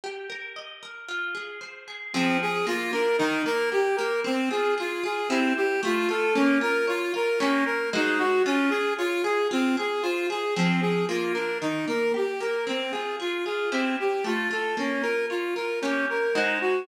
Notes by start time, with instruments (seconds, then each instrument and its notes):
0.04 acoustic guitar (steel) G4
0.30 acoustic guitar (steel) A#4
0.56 acoustic guitar (steel) D#5
0.83 acoustic guitar (steel) A#4
1.08 acoustic guitar (steel) F4
1.35 acoustic guitar (steel) G#4
1.61 acoustic guitar (steel) C5
1.88 acoustic guitar (steel) G#4
2.13 acoustic guitar (steel) F3 C4 G#4, clarinet C4
2.42 clarinet G#4
2.67 acoustic guitar (steel) A#3, clarinet F4
2.93 acoustic guitar (steel) D4, clarinet A#4
3.18 acoustic guitar (steel) D#3, clarinet D#4
3.46 acoustic guitar (steel) A#3, clarinet A#4
3.72 acoustic guitar (steel) G4, clarinet G4
3.96 acoustic guitar (steel) A#3, clarinet A#4
4.24 acoustic guitar (steel) C4, clarinet C4
4.50 acoustic guitar (steel) F4, clarinet G#4
4.78 clarinet F4, acoustic guitar (steel) G#4
5.04 acoustic guitar (steel) F4, clarinet G#4
5.29 clarinet C4, acoustic guitar (steel) E4 G4 C5
5.57 clarinet G4
5.83 acoustic guitar (steel) A3, clarinet F4
6.09 acoustic guitar (steel) F4, clarinet A4
6.35 acoustic guitar (steel) A#3, clarinet C#4
6.61 acoustic guitar (steel) F4, clarinet A#4
6.87 clarinet F4, acoustic guitar (steel) C#5
7.14 acoustic guitar (steel) F4, clarinet A#4
7.40 acoustic guitar (steel) A#3 G4 C#5, clarinet C#4
7.66 clarinet A#4
7.93 acoustic guitar (steel) G#3 F#4 C5 D#5, clarinet D#4
8.18 clarinet F#4
8.46 clarinet C#4, acoustic guitar (steel) F4
8.70 clarinet G#4, acoustic guitar (steel) G#4
8.98 clarinet F4, acoustic guitar (steel) C#5
9.24 clarinet G#4, acoustic guitar (steel) G#4
9.51 clarinet C4, acoustic guitar (steel) F4
9.77 acoustic guitar (steel) G#4, clarinet G#4
10.03 clarinet F4, acoustic guitar (steel) C5
10.30 acoustic guitar (steel) G#4, clarinet G#4
10.56 acoustic guitar (steel) F3 C4 G#4, clarinet C4
10.81 clarinet G#4
11.09 acoustic guitar (steel) A#3, clarinet F4
11.34 acoustic guitar (steel) D4, clarinet A#4
11.62 acoustic guitar (steel) D#3, clarinet D#4
11.88 acoustic guitar (steel) A#3, clarinet A#4
12.14 acoustic guitar (steel) G4, clarinet G4
12.40 acoustic guitar (steel) A#3, clarinet A#4
12.67 acoustic guitar (steel) C4, clarinet C4
12.92 acoustic guitar (steel) F4, clarinet G#4
13.20 clarinet F4, acoustic guitar (steel) G#4
13.45 acoustic guitar (steel) F4, clarinet G#4
13.72 clarinet C4, acoustic guitar (steel) E4 G4 C5
14.00 clarinet G4
14.24 acoustic guitar (steel) A3, clarinet F4
14.51 acoustic guitar (steel) F4, clarinet A4
14.77 acoustic guitar (steel) A#3, clarinet C#4
15.02 acoustic guitar (steel) F4, clarinet A#4
15.30 clarinet F4, acoustic guitar (steel) C#5
15.55 acoustic guitar (steel) F4, clarinet A#4
15.82 acoustic guitar (steel) A#3 G4 C#5, clarinet C#4
16.10 clarinet A#4
16.35 acoustic guitar (steel) G#3 F#4 C5 D#5, clarinet D#4
16.61 clarinet F#4